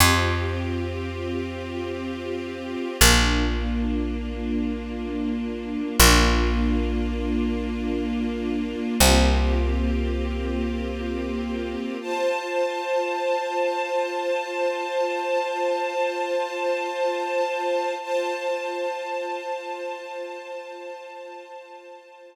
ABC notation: X:1
M:4/4
L:1/8
Q:1/4=80
K:F
V:1 name="String Ensemble 1"
[CFG]8 | [B,DF]8 | [B,DF]8 | [B,CFG]8 |
[Fca]8- | [Fca]8 | [Fca]8- | [Fca]8 |]
V:2 name="Electric Bass (finger)" clef=bass
F,,8 | B,,,8 | B,,,8 | C,,8 |
z8 | z8 | z8 | z8 |]